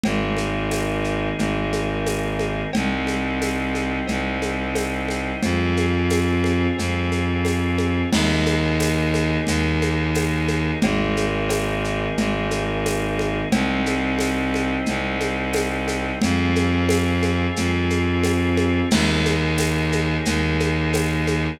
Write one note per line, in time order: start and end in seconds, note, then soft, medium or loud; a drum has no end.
0.04 1.29 G#1 medium
0.04 2.71 A#3 medium
0.04 2.71 D#4 medium
0.04 2.71 G#4 medium
0.04 cowbell loud
0.04 low conga loud
0.04 shaker medium
0.37 high conga medium
0.37 shaker medium
0.71 tambourine medium
0.71 cowbell medium
0.71 high conga medium
0.71 shaker medium
1.04 shaker medium
1.38 2.62 G#1 medium
1.38 cowbell medium
1.38 low conga medium
1.38 shaker medium
1.73 high conga medium
1.73 shaker medium
2.06 tambourine medium
2.06 cowbell medium
2.06 high conga medium
2.06 shaker medium
2.39 high conga medium
2.39 shaker medium
2.73 3.99 C2 medium
2.73 5.41 C4 medium
2.73 5.41 D#4 medium
2.73 5.41 G4 medium
2.73 cowbell loud
2.73 low conga loud
2.73 shaker medium
3.07 high conga medium
3.07 shaker medium
3.41 tambourine medium
3.41 cowbell medium
3.41 high conga medium
3.41 shaker medium
3.75 high conga medium
3.75 shaker medium
4.07 5.32 C2 medium
4.07 cowbell medium
4.07 low conga medium
4.07 shaker medium
4.42 high conga medium
4.42 shaker medium
4.75 tambourine medium
4.75 cowbell medium
4.75 high conga medium
4.75 shaker medium
5.08 high conga medium
5.08 shaker medium
5.43 6.67 F2 medium
5.43 8.10 C4 medium
5.43 8.10 F4 medium
5.43 8.10 G#4 medium
5.43 cowbell medium
5.43 low conga loud
5.43 shaker medium
5.77 high conga medium
5.77 shaker medium
6.10 tambourine medium
6.10 cowbell medium
6.10 high conga medium
6.10 shaker medium
6.44 high conga medium
6.44 shaker medium
6.78 8.02 F2 medium
6.78 cowbell medium
6.78 low conga medium
6.78 shaker medium
7.12 high conga medium
7.12 shaker medium
7.45 tambourine medium
7.45 cowbell medium
7.45 high conga medium
7.45 shaker medium
7.78 high conga medium
7.78 shaker medium
8.12 9.37 D#2 loud
8.12 10.80 A#3 medium
8.12 10.80 D#4 medium
8.12 10.80 G#4 medium
8.12 crash loud
8.12 cowbell loud
8.12 low conga loud
8.12 shaker loud
8.46 high conga medium
8.46 shaker medium
8.79 tambourine medium
8.79 cowbell medium
8.79 high conga medium
8.79 shaker medium
9.14 high conga medium
9.14 shaker medium
9.47 10.71 D#2 medium
9.47 cowbell medium
9.47 low conga medium
9.47 shaker loud
9.82 high conga medium
9.82 shaker medium
10.14 tambourine medium
10.14 cowbell medium
10.14 high conga medium
10.14 shaker medium
10.48 high conga medium
10.48 shaker medium
10.82 12.07 G#1 medium
10.82 13.49 A#3 medium
10.82 13.49 D#4 medium
10.82 13.49 G#4 medium
10.82 cowbell loud
10.82 low conga loud
10.82 shaker medium
11.17 high conga medium
11.17 shaker medium
11.49 tambourine medium
11.49 cowbell medium
11.49 high conga medium
11.49 shaker medium
11.84 shaker medium
12.17 13.41 G#1 medium
12.17 cowbell medium
12.17 low conga loud
12.17 shaker medium
12.51 high conga medium
12.51 shaker medium
12.86 tambourine medium
12.86 cowbell medium
12.86 high conga medium
12.86 shaker medium
13.19 high conga medium
13.19 shaker medium
13.52 14.76 C2 medium
13.52 16.19 C4 medium
13.52 16.19 D#4 loud
13.52 16.19 G4 medium
13.52 cowbell loud
13.52 low conga loud
13.52 shaker medium
13.86 high conga medium
13.86 shaker medium
14.19 tambourine medium
14.19 cowbell medium
14.19 high conga medium
14.19 shaker medium
14.54 high conga medium
14.54 shaker medium
14.86 16.11 C2 medium
14.86 cowbell medium
14.86 low conga medium
14.86 shaker medium
15.21 high conga medium
15.21 shaker medium
15.53 tambourine medium
15.53 cowbell medium
15.53 high conga loud
15.53 shaker medium
15.88 high conga medium
15.88 shaker medium
16.21 17.46 F2 medium
16.21 18.89 C4 loud
16.21 18.89 F4 medium
16.21 18.89 G#4 medium
16.21 cowbell medium
16.21 low conga loud
16.21 shaker medium
16.55 high conga medium
16.55 shaker medium
16.89 tambourine medium
16.89 cowbell medium
16.89 high conga loud
16.89 shaker medium
17.23 high conga medium
17.23 shaker medium
17.56 18.81 F2 medium
17.56 cowbell medium
17.56 low conga medium
17.56 shaker loud
17.90 high conga medium
17.90 shaker medium
18.23 tambourine medium
18.23 cowbell medium
18.23 high conga medium
18.23 shaker medium
18.57 high conga medium
18.57 shaker medium
18.91 20.16 D#2 loud
18.91 21.59 A#3 medium
18.91 21.59 D#4 medium
18.91 21.59 G#4 medium
18.91 crash loud
18.91 cowbell loud
18.91 low conga loud
18.91 shaker loud
19.26 high conga medium
19.26 shaker medium
19.58 tambourine medium
19.58 cowbell medium
19.58 high conga medium
19.58 shaker medium
19.92 high conga medium
19.92 shaker medium
20.25 21.50 D#2 medium
20.25 cowbell medium
20.25 low conga medium
20.25 shaker loud
20.60 high conga medium
20.60 shaker medium
20.93 tambourine medium
20.93 cowbell medium
20.93 high conga medium
20.93 shaker medium
21.27 high conga medium
21.27 shaker medium